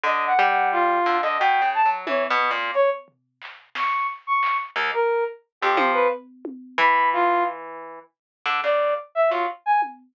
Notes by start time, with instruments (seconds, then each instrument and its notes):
0.04 orchestral harp D3, brass section D#5
0.27 brass section F#5
0.39 orchestral harp G3
0.50 brass section F#5
0.72 brass section F4
1.06 orchestral harp D3
1.22 orchestral harp D3, brass section D#5
1.39 orchestral harp B2, brass section G5
1.62 orchestral harp C#3
1.74 brass section A5
1.86 orchestral harp F#3
2.07 orchestral harp E3, brass section C#5, high tom
2.30 orchestral harp B2
2.51 orchestral harp A#2
2.74 brass section C#5, closed hi-hat
3.08 floor tom
3.42 clap
3.75 brass section C#6, snare
4.27 brass section C#6
4.43 clap
4.76 orchestral harp D#2
4.94 brass section A#4
5.62 orchestral harp F2, brass section G4
5.77 orchestral harp F3, high tom
5.93 brass section B4
6.45 high tom
6.78 orchestral harp E3, brass section B5, floor tom
7.13 brass section F4
8.46 orchestral harp D3
8.64 orchestral harp C#3, brass section D5
9.15 brass section E5
9.30 orchestral harp F#3, brass section F4
9.66 brass section G#5
9.82 high tom